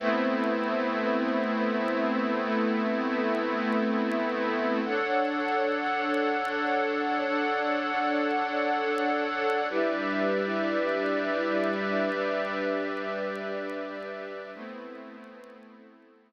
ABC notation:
X:1
M:4/4
L:1/8
Q:1/4=99
K:Ador
V:1 name="Pad 5 (bowed)"
[A,B,CE]8- | [A,B,CE]8 | [DA^cf]8- | [DA^cf]8 |
[GBde]8- | [GBde]8 | [A,B,CE]8 |]
V:2 name="String Ensemble 1"
[A,Bce]8 | [A,ABe]8 | [DA^cf]8 | [DAdf]8 |
[G,DEB]8 | [G,DGB]8 | [A,EBc]4 [A,EAc]4 |]